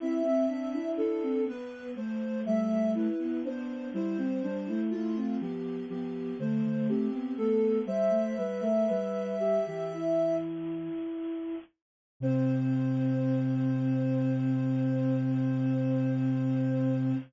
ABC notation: X:1
M:4/4
L:1/16
Q:1/4=61
K:C
V:1 name="Ocarina"
e4 A2 B2 c2 e2 B2 c2 | c4 F2 G2 G2 c2 G2 A2 | "^rit." e10 z6 | c16 |]
V:2 name="Ocarina"
E C D E E C B,2 A,2 A,3 B, B,2 | E C D E E C B,2 B,2 A,3 B, B,2 | "^rit." c2 B ^A B2 G G E6 z2 | C16 |]
V:3 name="Ocarina"
C C C D D2 B,2 A,2 G, G, E2 D2 | G, G, G, A, A,2 F,2 F,2 D, D, C2 A,2 | "^rit." G, A, G, A, G,3 E,5 z4 | C,16 |]